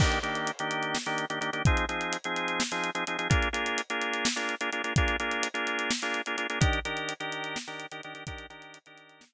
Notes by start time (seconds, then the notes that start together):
0.00 D#3 A#3 D4 G4, kick, crash
0.12 closed hi-hat
0.23 D#3 A#3 D4 G4, closed hi-hat
0.35 closed hi-hat
0.47 closed hi-hat
0.59 D#3 A#3 D4 G4, closed hi-hat
0.71 closed hi-hat
0.83 closed hi-hat
0.95 snare
1.06 D#3 A#3 D4 G4, closed hi-hat
1.18 closed hi-hat
1.30 D#3 A#3 D4 G4, closed hi-hat
1.41 D#3 A#3 D4 G4, closed hi-hat
1.53 D#3 A#3 D4 G4, closed hi-hat
1.65 F3 C4 D#4 G#4, kick, closed hi-hat
1.77 closed hi-hat
1.89 F3 C4 D#4 G#4, closed hi-hat
2.01 closed hi-hat
2.13 closed hi-hat
2.24 F3 C4 D#4 G#4, closed hi-hat
2.36 closed hi-hat
2.48 closed hi-hat
2.60 snare
2.72 F3 C4 D#4 G#4, closed hi-hat
2.84 closed hi-hat
2.95 F3 C4 D#4 G#4, closed hi-hat
3.07 F3 C4 D#4 G#4, closed hi-hat
3.19 F3 C4 D#4 G#4, closed hi-hat
3.30 A#3 D4 F4 G#4, kick, closed hi-hat
3.42 closed hi-hat
3.53 A#3 D4 F4 G#4, closed hi-hat
3.66 closed hi-hat
3.78 closed hi-hat
3.90 A#3 D4 F4 G#4, closed hi-hat
4.01 closed hi-hat
4.13 closed hi-hat
4.25 snare
4.36 A#3 D4 F4 G#4, closed hi-hat
4.49 closed hi-hat
4.61 A#3 D4 F4 G#4, closed hi-hat
4.72 A#3 D4 F4 G#4, closed hi-hat
4.84 A#3 D4 F4 G#4, closed hi-hat
4.96 A#3 D4 F4 G#4, kick, closed hi-hat
5.08 closed hi-hat
5.20 A#3 D4 F4 G#4, closed hi-hat
5.31 closed hi-hat
5.43 closed hi-hat
5.54 A#3 D4 F4 G#4, closed hi-hat
5.67 closed hi-hat
5.79 closed hi-hat
5.91 snare
6.02 A#3 D4 F4 G#4, closed hi-hat
6.14 closed hi-hat
6.26 A#3 D4 F4 G#4, closed hi-hat
6.37 A#3 D4 F4 G#4, closed hi-hat
6.50 A#3 D4 F4 G#4, closed hi-hat
6.61 D#3 D4 G4 A#4, kick, closed hi-hat
6.73 closed hi-hat
6.85 D#3 D4 G4 A#4, closed hi-hat
6.97 closed hi-hat
7.09 closed hi-hat
7.20 D#3 D4 G4 A#4, closed hi-hat
7.32 closed hi-hat
7.44 closed hi-hat
7.56 snare
7.67 D#3 D4 G4 A#4, closed hi-hat
7.80 closed hi-hat
7.92 D#3 D4 G4 A#4, closed hi-hat
8.03 D#3 D4 G4 A#4, closed hi-hat
8.14 D#3 D4 G4 A#4, closed hi-hat
8.27 D#3 D4 G4 A#4, kick, closed hi-hat
8.38 closed hi-hat
8.50 D#3 D4 G4 A#4, closed hi-hat
8.62 closed hi-hat
8.74 closed hi-hat
8.86 D#3 D4 G4 A#4, closed hi-hat
8.98 closed hi-hat
9.09 closed hi-hat
9.21 snare
9.33 D#3 D4 G4 A#4